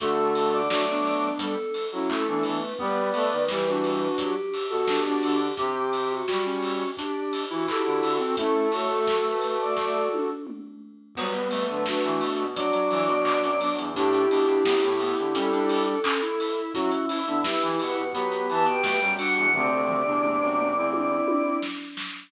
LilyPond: <<
  \new Staff \with { instrumentName = "Choir Aahs" } { \time 4/4 \key d \major \tempo 4 = 86 r8. d''4~ d''16 a'8. fis'16 a'8 b'8 | r8. b'4~ b'16 g'8. fis'16 g'8 g'8 | r8. fis'4~ fis'16 g'8. fis'16 g'8 fis'8 | a'8 cis''16 a'8 b'8 d''16 d''8 r4. |
\key b \minor b'4. r8 d''2 | g'4. r8 a'2 | e''4. fis''8 b''8 a''16 g''8. fis''16 fis''16 | d''2 d''4 r4 | }
  \new Staff \with { instrumentName = "Flute" } { \time 4/4 \key d \major <fis' a'>4 <d' fis'>16 <b d'>4 r8 <cis' e'>8 <b d'>8 r16 | <b' d''>4 <g' b'>16 <d' fis'>4 r8 <fis' a'>8 <d' fis'>8 r16 | r2. <fis' a'>4 | <cis' e'>8 <fis' a'>2~ <fis' a'>8 r4 |
\key b \minor <g b>8. <fis a>16 <d' fis'>4 <d' fis'>4. <b d'>8 | <e' g'>2. r4 | <cis' e'>8. <b d'>16 <g' b'>4 <g' b'>4. <d' fis'>8 | <a c'>8. <b d'>4 <c' e'>4~ <c' e'>16 r4 | }
  \new Staff \with { instrumentName = "Lead 1 (square)" } { \time 4/4 \key d \major a4 fis4 g16 r8. a4 | b4 g4 fis16 r8. d'4 | g'4 fis'16 cis'8. d'8. e'16 e'16 e'8 c'16 | a2~ a8 r4. |
\key b \minor b8 a4. fis16 fis16 fis4. | d'8 d'16 d'16 b16 r16 b16 r16 cis'16 d'8. cis'16 e'8. | fis'8 e'4. b4 a16 g8. | c2 r2 | }
  \new Staff \with { instrumentName = "Brass Section" } { \time 4/4 \key d \major d4 a4 r8. fis16 r16 e16 e16 r16 | g8 a16 dis16 e4 r8. b,8. d8 | c4 g4 r8. e16 r16 d16 d16 r16 | a2~ a8 r4. |
\key b \minor fis16 r8 d16 r16 e16 b,16 b,16 fis8 e16 b,8 fis,16 r16 e,16 | a,8 b,8 fis,16 a,8 d16 g4 r4 | fis16 r8 d16 r16 e16 b,16 b,16 fis8 e16 b,8 fis,16 r16 e,16 | d,16 d,8 e,8 fis,8 e,8. r4. | }
  \new DrumStaff \with { instrumentName = "Drums" } \drummode { \time 4/4 <hh bd>8 hho8 <bd sn>8 hho8 <hh bd>8 hho8 <hc bd>8 hho8 | bd8 hho8 <bd sn>8 hho8 <hh bd>8 hho8 <bd sn>8 hho8 | <hh bd>8 hho8 <bd sn>8 hho8 <hh bd>8 hho8 <hc bd>8 hho8 | <hh bd>8 hho8 <bd sn>8 hho8 <bd sn>8 tommh8 toml4 |
<cymc bd>16 hh16 hho16 hh16 <bd sn>16 hh16 hho16 hh16 <hh bd>16 hh16 hho16 hh16 <hc bd>16 hh16 hho16 hh16 | <hh bd>16 hh16 hho16 hh16 <bd sn>16 hh16 hho16 hh16 <hh bd>16 hh16 hho16 hh16 <hc bd>16 hh16 hho16 hh16 | <hh bd>16 hh16 hho16 hh16 <bd sn>16 hh16 hho16 hh16 <hh bd>16 hh16 hho16 hh16 <bd sn>16 hh16 hho16 hh16 | <bd tomfh>8 tomfh8 toml8 toml8 tommh8 tommh8 sn8 sn8 | }
>>